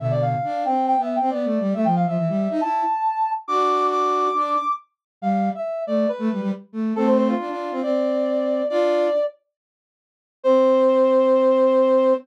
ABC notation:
X:1
M:4/4
L:1/16
Q:1/4=138
K:C
V:1 name="Brass Section"
e d f4 g2 (3g2 e2 g2 d4 | e g f e5 a8 | d'4 d'8 z4 | f3 e3 d2 B4 z4 |
A c c F5 d8 | d6 z10 | c16 |]
V:2 name="Flute"
[B,,D,]4 D2 C3 B,2 C (3B,2 A,2 G,2 | A, F,2 F, E, G,2 ^D E2 z6 | [D^F]8 D2 z6 | G,3 z3 A,2 z A, G, G, z2 A,2 |
[A,C]4 D D2 C C8 | [DF]4 z12 | C16 |]